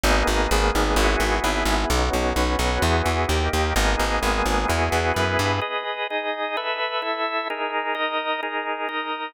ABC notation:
X:1
M:4/4
L:1/8
Q:1/4=129
K:B
V:1 name="Drawbar Organ"
[A,B,DG]2 [G,A,B,G]2 [B,EFG]2 [B,EGB]2 | [B,CDF]2 [B,CFB]2 [B,EFG]2 [A,D=G]2 | [A,B,DG]2 [G,A,B,G]2 [B,EFG]2 [B,EGB]2 | [K:G#m] [GBd]2 [DGd]2 [=ABe]2 [EAe]2 |
[DGA]2 [DAd]2 [DGA]2 [DAd]2 |]
V:2 name="Electric Bass (finger)" clef=bass
G,,, G,,, G,,, G,,, G,,, G,,, G,,, G,,, | B,,, B,,, B,,, B,,, E,, E,, D,, D,, | G,,, G,,, G,,, G,,, E,, E,, F,, =G,, | [K:G#m] z8 |
z8 |]